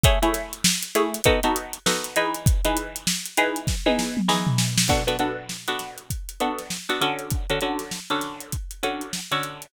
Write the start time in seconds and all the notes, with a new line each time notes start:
0.03 A3 E4 G#4 C#5, kick, closed hi-hat
0.22 A3 E4 G#4 C#5, closed hi-hat
0.34 snare, closed hi-hat
0.53 closed hi-hat
0.64 snare
0.83 closed hi-hat
0.95 A3 E4 G#4 C#5, closed hi-hat
1.14 closed hi-hat
1.24 B3 D#4 F#4 A4, kick, closed hi-hat
1.43 B3 D#4 F#4 A4, closed hi-hat
1.56 closed hi-hat
1.73 closed hi-hat
1.86 B3 D#4 F#4 A4, snare
2.04 closed hi-hat
2.16 E3 D#4 G#4 B4, closed hi-hat
2.34 closed hi-hat
2.46 kick, closed hi-hat
2.65 E3 D#4 G#4 B4, closed hi-hat
2.77 closed hi-hat
2.96 closed hi-hat
3.07 snare
3.26 closed hi-hat
3.37 E3 D#4 G#4 B4, closed hi-hat
3.56 closed hi-hat
3.67 kick, snare
3.86 E3 D#4 G#4 B4, high tom
3.99 snare
4.17 mid tom
4.28 E3 D#4 G#4 B4, snare
4.47 floor tom
4.58 snare
4.78 snare
4.88 B3 D4 F#4 A4, kick, crash
5.07 B3 D4 F#4 A4, closed hi-hat
5.19 B3 D4 F#4 A4, closed hi-hat
5.49 snare
5.68 B3 D4 F#4 A4, closed hi-hat
5.79 snare, closed hi-hat
5.98 closed hi-hat
6.10 kick, closed hi-hat
6.29 closed hi-hat
6.40 B3 D4 F#4 A4, closed hi-hat
6.58 snare, closed hi-hat
6.70 snare
6.89 B3 D4 F#4 A4, closed hi-hat
7.01 D3 C#4 F#4 A4, closed hi-hat
7.19 closed hi-hat
7.30 kick, closed hi-hat
7.50 D3 C#4 F#4 A4, closed hi-hat
7.61 D3 C#4 F#4 A4, closed hi-hat
7.79 snare, closed hi-hat
7.91 snare
8.10 D3 C#4 F#4 A4, closed hi-hat
8.21 snare, closed hi-hat
8.40 closed hi-hat
8.52 kick, closed hi-hat
8.71 closed hi-hat
8.83 D3 C#4 F#4 A4, closed hi-hat
9.01 closed hi-hat
9.13 snare
9.31 D3 C#4 F#4 A4, closed hi-hat
9.43 closed hi-hat
9.62 closed hi-hat